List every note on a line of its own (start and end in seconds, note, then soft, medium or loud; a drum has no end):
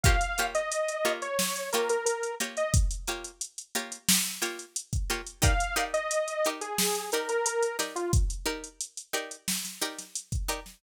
0.04 0.17 A#3 loud
0.04 0.17 F4 medium
0.04 0.17 G4 loud
0.04 0.17 C#5 loud
0.04 0.47 F5 medium
0.04 kick medium
0.04 closed hi-hat medium
0.21 closed hi-hat medium
0.38 0.62 A#3 medium
0.38 0.62 F4 medium
0.38 0.62 G4 medium
0.38 0.62 C#5 medium
0.38 closed hi-hat medium
0.55 1.12 D#5 medium
0.55 closed hi-hat medium
0.72 closed hi-hat medium
0.88 closed hi-hat medium
1.05 1.28 A#3 medium
1.05 1.28 F4 medium
1.05 1.28 G4 medium
1.05 1.28 C#5 medium
1.22 1.70 C#5 medium
1.22 closed hi-hat medium
1.39 snare medium
1.56 closed hi-hat medium
1.73 1.97 A#3 medium
1.73 1.97 F4 medium
1.73 1.97 G4 medium
1.73 1.89 A#4 medium
1.73 1.97 C#5 medium
1.73 closed hi-hat medium
1.89 2.05 A#4 medium
1.89 closed hi-hat medium
2.05 2.35 A#4 medium
2.05 closed hi-hat medium
2.23 closed hi-hat medium
2.40 2.64 A#3 medium
2.40 2.64 F4 medium
2.40 2.64 G4 medium
2.40 2.64 C#5 medium
2.40 closed hi-hat medium
2.57 2.73 D#5 medium
2.57 closed hi-hat medium
2.74 kick medium
2.74 closed hi-hat loud
2.91 closed hi-hat medium
3.07 3.31 A#3 medium
3.07 3.31 F4 medium
3.07 3.31 G4 medium
3.07 3.31 C#5 medium
3.07 closed hi-hat medium
3.24 closed hi-hat medium
3.41 closed hi-hat medium
3.58 closed hi-hat medium
3.75 3.99 A#3 medium
3.75 3.99 F4 medium
3.75 3.99 G4 medium
3.75 3.99 C#5 medium
3.75 closed hi-hat medium
3.92 closed hi-hat medium
4.09 snare loud
4.25 closed hi-hat medium
4.42 4.65 A#3 medium
4.42 4.65 F4 medium
4.42 4.65 G4 medium
4.42 4.65 C#5 medium
4.42 closed hi-hat medium
4.59 closed hi-hat medium
4.76 closed hi-hat medium
4.93 kick medium
4.93 closed hi-hat medium
5.10 5.21 A#3 medium
5.10 5.21 F4 medium
5.10 5.21 G4 medium
5.10 5.21 C#5 medium
5.10 closed hi-hat medium
5.27 closed hi-hat medium
5.42 5.54 D#4 loud
5.42 5.54 G4 loud
5.42 5.54 A#4 loud
5.42 5.54 D5 loud
5.42 5.84 F5 medium
5.42 kick medium
5.42 closed hi-hat loud
5.60 closed hi-hat medium
5.76 6.00 D#4 medium
5.76 6.00 G4 medium
5.76 6.00 A#4 medium
5.76 6.00 D5 medium
5.76 closed hi-hat medium
5.94 6.49 D#5 medium
5.94 closed hi-hat medium
6.11 closed hi-hat medium
6.28 closed hi-hat medium
6.45 6.69 D#4 medium
6.45 6.69 G4 medium
6.45 6.69 A#4 medium
6.45 6.69 D5 medium
6.45 closed hi-hat medium
6.61 7.10 G#4 medium
6.61 closed hi-hat medium
6.78 snare medium
6.95 closed hi-hat medium
7.12 7.37 D#4 medium
7.12 7.37 G4 medium
7.12 7.29 A#4 medium
7.12 7.37 A#4 medium
7.12 7.37 D5 medium
7.12 closed hi-hat medium
7.29 7.45 A#4 medium
7.29 closed hi-hat medium
7.46 7.77 A#4 medium
7.46 closed hi-hat loud
7.62 closed hi-hat medium
7.79 8.02 D#4 medium
7.79 8.02 G4 medium
7.79 8.02 A#4 medium
7.79 8.02 D5 medium
7.79 snare soft
7.79 closed hi-hat medium
7.96 8.12 F4 medium
7.96 closed hi-hat medium
8.13 kick medium
8.13 closed hi-hat medium
8.30 closed hi-hat medium
8.46 8.69 D#4 medium
8.46 8.69 G4 medium
8.46 8.69 A#4 medium
8.46 8.69 D5 medium
8.64 closed hi-hat medium
8.80 closed hi-hat medium
8.97 closed hi-hat medium
9.13 9.37 D#4 medium
9.13 9.37 G4 medium
9.13 9.37 A#4 medium
9.13 9.37 D5 medium
9.13 closed hi-hat medium
9.31 closed hi-hat medium
9.48 snare medium
9.65 snare soft
9.65 closed hi-hat medium
9.81 10.05 D#4 medium
9.81 10.05 G4 medium
9.81 10.05 A#4 medium
9.81 10.05 D5 medium
9.81 closed hi-hat medium
9.98 snare soft
9.98 closed hi-hat medium
10.15 closed hi-hat medium
10.32 kick medium
10.32 closed hi-hat medium
10.48 10.60 D#4 medium
10.48 10.60 G4 medium
10.48 10.60 A#4 medium
10.48 10.60 D5 medium
10.48 closed hi-hat medium
10.66 snare soft